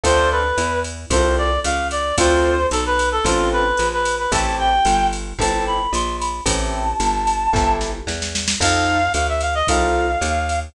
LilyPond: <<
  \new Staff \with { instrumentName = "Clarinet" } { \time 4/4 \key a \minor \tempo 4 = 112 c''8 b'4 r8 c''8 d''8 f''8 d''8 | c''4 a'16 b'8 a'16 f'8 b'8. b'8 b'16 | a''8 g''4 r8 a''8 b''8 c'''8 b''8 | a''2~ a''8 r4. |
f''4 f''16 e''16 f''16 ees''16 f''2 | }
  \new Staff \with { instrumentName = "Acoustic Grand Piano" } { \time 4/4 \key a \minor <c' d' f' a'>2 <c' d' f' a'>2 | <c' d' f' a'>2 <c' d' f' a'>2 | <c' e' g' a'>2 <c' e' g' a'>2 | <c' e' g' a'>2 <c' e' g' a'>2 |
<c' ees' f' a'>2 <c' ees' f' a'>2 | }
  \new Staff \with { instrumentName = "Electric Bass (finger)" } { \clef bass \time 4/4 \key a \minor d,4 e,4 c,4 des,4 | d,4 b,,4 a,,4 bes,,4 | a,,4 g,,4 g,,4 bes,,4 | a,,4 g,,4 g,,4 e,4 |
f,4 d,4 c,4 ees,4 | }
  \new DrumStaff \with { instrumentName = "Drums" } \drummode { \time 4/4 <bd cymr>4 <hhp cymr>8 cymr8 <bd cymr>4 <hhp cymr>8 cymr8 | <bd cymr>4 <hhp cymr>8 cymr8 <bd cymr>4 <hhp cymr>8 cymr8 | <bd cymr>4 <hhp cymr>8 cymr8 <bd cymr>4 <hhp cymr>8 cymr8 | <bd cymr>4 <hhp cymr>8 cymr8 <bd sn>8 sn8 sn16 sn16 sn16 sn16 |
<cymc bd cymr>4 <hhp cymr>8 cymr8 <bd cymr>4 <hhp cymr>8 cymr8 | }
>>